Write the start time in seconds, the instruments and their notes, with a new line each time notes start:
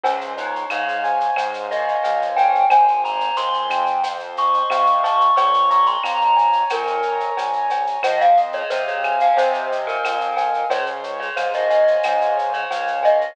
0.03 synth bass 1 C#2, glockenspiel C#4, acoustic grand piano C5, cowbell, shaker
0.21 shaker
0.37 glockenspiel D#4, acoustic grand piano C#5, shaker
0.55 shaker
0.70 synth bass 1 G#2, glockenspiel C#5, acoustic grand piano F5, claves, shaker
0.88 shaker
1.04 acoustic grand piano G#5, shaker
1.20 shaker
1.36 synth bass 1 G#2, acoustic grand piano C5, cowbell, claves, shaker
1.54 shaker
1.71 acoustic grand piano C#5, glockenspiel D#5, shaker
1.88 shaker
2.03 synth bass 1 C#2, acoustic grand piano F5, cowbell, shaker
2.22 shaker
2.36 glockenspiel G5, acoustic grand piano G#5, cowbell, shaker
2.55 shaker
2.70 synth bass 1 G#1, acoustic grand piano C5, glockenspiel G#5, cowbell, claves, shaker
2.88 shaker
3.04 acoustic grand piano G#5, glockenspiel A#5, shaker
3.20 shaker
3.36 synth bass 1 D#2, acoustic grand piano C5, glockenspiel C6, shaker
3.54 shaker
3.69 synth bass 1 F2, acoustic grand piano G5, claves, shaker
3.86 shaker
4.03 acoustic grand piano C5, cowbell, shaker
4.19 shaker
4.37 acoustic grand piano D#5, glockenspiel C#6, shaker
4.54 shaker
4.70 synth bass 1 C3, acoustic grand piano F5, cowbell, claves, shaker
4.86 shaker
5.04 acoustic grand piano A5, glockenspiel C#6, cowbell, shaker
5.21 shaker
5.36 synth bass 1 A#1, acoustic grand piano C#5, glockenspiel C#6, cowbell, shaker
5.54 shaker
5.70 acoustic grand piano A#5, glockenspiel C#6, shaker
5.86 glockenspiel C6, shaker
6.03 synth bass 1 F2, acoustic grand piano C#5, glockenspiel A#5, claves, shaker
6.21 shaker
6.36 acoustic grand piano G#5, shaker
6.53 shaker
6.70 synth bass 1 F2, glockenspiel A#4, acoustic grand piano C#5, cowbell, claves, shaker
6.87 shaker
7.03 acoustic grand piano A#5, shaker
7.20 shaker
7.37 synth bass 1 A#1, acoustic grand piano G#5, cowbell, shaker
7.53 shaker
7.70 acoustic grand piano C#5, cowbell, shaker
7.87 shaker
8.03 synth bass 1 F2, acoustic grand piano C5, glockenspiel D#5, cowbell, claves, shaker
8.21 glockenspiel F5, shaker
8.37 acoustic grand piano D#5, shaker
8.53 glockenspiel C#5, shaker
8.70 synth bass 1 C3, glockenspiel C5, acoustic grand piano F5, shaker
8.88 glockenspiel C#5, shaker
9.03 acoustic grand piano G#5, claves, shaker
9.20 glockenspiel F5, shaker
9.37 synth bass 1 C3, acoustic grand piano C5, glockenspiel C5, cowbell, shaker
9.54 shaker
9.71 acoustic grand piano D#5, shaker
9.87 glockenspiel A#4, shaker
10.03 synth bass 1 F2, acoustic grand piano F5, cowbell, claves, shaker
10.21 shaker
10.36 acoustic grand piano G#5, cowbell, shaker
10.54 shaker
10.70 synth bass 1 C#2, acoustic grand piano C5, glockenspiel C#5, cowbell, shaker
10.86 shaker
11.03 acoustic grand piano C#5, shaker
11.20 glockenspiel C#5, shaker
11.36 synth bass 1 G#2, glockenspiel C5, acoustic grand piano F5, claves, shaker
11.53 glockenspiel D#5, shaker
11.70 acoustic grand piano G#5, shaker
11.87 shaker
12.03 synth bass 1 G#2, acoustic grand piano C5, cowbell, claves, shaker
12.21 shaker
12.37 acoustic grand piano C#5, shaker
12.53 glockenspiel C#5, shaker
12.70 synth bass 1 C#2, acoustic grand piano F5, cowbell, shaker
12.87 shaker
13.03 glockenspiel D#5, acoustic grand piano G#5, cowbell, shaker
13.21 shaker